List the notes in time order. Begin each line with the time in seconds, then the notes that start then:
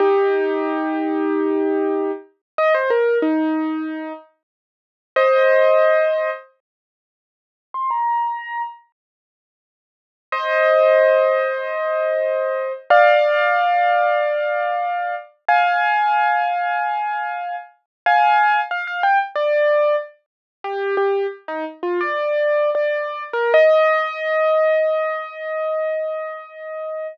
0.00 D#4 G4
2.58 D#5
2.74 C5
2.90 A#4
3.22 D#4
5.16 C5 D#5
7.74 C6
7.90 A#5
10.32 C5 D#5
12.90 D5 F5
15.49 F5 G#5
18.06 F5 G#5
18.71 F5
18.87 F5
19.03 G5
19.35 D5
20.64 G4
20.97 G4
21.48 D#4
21.83 F4
22.01 D5
22.75 D5
23.33 A#4
23.54 D#5